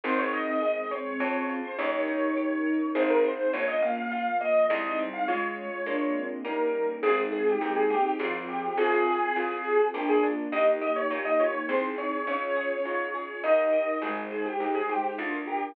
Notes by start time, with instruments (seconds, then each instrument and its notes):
0.04 electric bass (finger) G#1, string ensemble 1 C4 D#4 G#4, orchestral harp C4, ocarina C4, acoustic grand piano C5
0.18 acoustic grand piano C#5
0.33 orchestral harp D#4, acoustic grand piano D#5
0.47 acoustic grand piano D#5
0.62 string ensemble 1 G#3 C4 G#4, orchestral harp G#4, acoustic grand piano D#5
0.91 orchestral harp C4, acoustic grand piano C#5
1.20 electric bass (finger) F2, string ensemble 1 C#4 F4 G#4, orchestral harp C#4, acoustic grand piano C#5
1.49 orchestral harp F4
1.64 acoustic grand piano C5
1.78 electric bass (finger) D#2, string ensemble 1 C#4 D#4 G4 A#4, orchestral harp C#4, ocarina D#4, acoustic grand piano C#5
2.08 orchestral harp D#4
2.37 string ensemble 1 C#4 D#4 A#4 C#5, orchestral harp G4
2.66 orchestral harp A#4
2.94 electric bass (finger) G#1, string ensemble 1 C4 D#4 G#4, orchestral harp C4 D#4 G#4, acoustic grand piano C5
3.10 acoustic grand piano A#4
3.24 acoustic grand piano C5
3.53 electric bass (finger) A#1, orchestral harp A#3, ocarina A#3, string ensemble 1 A#3 C#4 F4, acoustic grand piano C#5
3.68 acoustic grand piano D#5
3.82 ocarina A#3, orchestral harp C#4, acoustic grand piano F5
3.97 acoustic grand piano F5
4.11 string ensemble 1 F3 A#3 F4, orchestral harp F4, acoustic grand piano F5
4.41 ocarina A#3, orchestral harp A#3, acoustic grand piano D#5
4.70 electric bass (finger) C2, string ensemble 1 G#3 C4 D#4, orchestral harp G#3, ocarina G#3, acoustic grand piano D#5
4.99 ocarina G3, orchestral harp C4
5.13 acoustic grand piano F5
5.28 ocarina G#3, orchestral harp G#3 C#4 F4, string ensemble 1 G#3 C#4 F4, acoustic grand piano C#5
5.72 ocarina G#3
5.86 string ensemble 1 G#3 A#3 D4 F4, orchestral harp G#3 A#3 D4 F4, ocarina D4
6.15 ocarina C4
6.45 orchestral harp G3 A#3 C#4 D#4, string ensemble 1 G3 A#3 C#4 D#4, acoustic grand piano A#4
7.03 electric bass (finger) G#1, ocarina G#3, orchestral harp C4, string ensemble 1 C4 D#4 G#4, acoustic grand piano G#4
7.32 acoustic grand piano G#4, orchestral harp G#4
7.46 acoustic grand piano G4
7.61 electric bass (finger) D#2, ocarina G#3, orchestral harp D#4, acoustic grand piano G4
7.76 acoustic grand piano G#4
7.90 ocarina A#3, acoustic grand piano G4, orchestral harp G#4
8.05 acoustic grand piano G4
8.18 electric bass (finger) G#1, ocarina F3, string ensemble 1 C4 F4 G#4, orchestral harp C4 F4 G#4, acoustic grand piano F4
8.48 acoustic grand piano G4
8.77 electric bass (finger) G#1, string ensemble 1 C4 F4 G#4, orchestral harp C4, ocarina F4, acoustic grand piano G#4
9.07 orchestral harp G#4
9.36 electric bass (finger) C2, orchestral harp F4, ocarina F4
9.65 ocarina G4, orchestral harp G#4
9.93 electric bass (finger) A#1, string ensemble 1 A#3 D4 F4, orchestral harp A#3, ocarina D4, acoustic grand piano G4
10.09 acoustic grand piano G#4
10.23 orchestral harp D4
10.52 electric bass (finger) D#2, orchestral harp A#3, string ensemble 1 A#3 D#4 G4, ocarina G4, acoustic grand piano D#5
10.81 orchestral harp G4, acoustic grand piano D#5
10.96 acoustic grand piano C#5
11.10 electric bass (finger) A#2, orchestral harp D#4, ocarina G4, acoustic grand piano C#5
11.25 acoustic grand piano D#5
11.40 ocarina F4, orchestral harp G4, acoustic grand piano C#5
11.54 acoustic grand piano C#5
11.68 electric bass (finger) C2, string ensemble 1 C4 D#4 G#4, orchestral harp C4, ocarina G#4, acoustic grand piano C5
11.98 orchestral harp G#4, acoustic grand piano C#5
12.26 electric bass (finger) C#2, string ensemble 1 C#4 F4 G#4, orchestral harp C#4, ocarina C#4, acoustic grand piano C#5
12.56 orchestral harp G#4
12.85 electric bass (finger) G#2, orchestral harp F4
13.14 orchestral harp G#4
13.43 electric bass (finger) D#2, string ensemble 1 D#4 G4 A#4, orchestral harp D#4, acoustic grand piano D#5
13.73 orchestral harp G4
14.02 electric bass (finger) G#1, ocarina G#3, orchestral harp D#4, string ensemble 1 D#4 G#4 C5, acoustic grand piano G#4
14.31 acoustic grand piano G#4, orchestral harp C5
14.46 acoustic grand piano G4
14.60 electric bass (finger) D#2, acoustic grand piano G4, orchestral harp G#4
14.75 acoustic grand piano G#4
14.89 ocarina G#3, acoustic grand piano G4, orchestral harp C5
15.04 acoustic grand piano G4
15.18 electric bass (finger) D2, ocarina D4, string ensemble 1 D4 F4 A#4, orchestral harp D4, acoustic grand piano F4
15.47 acoustic grand piano G4, orchestral harp A#4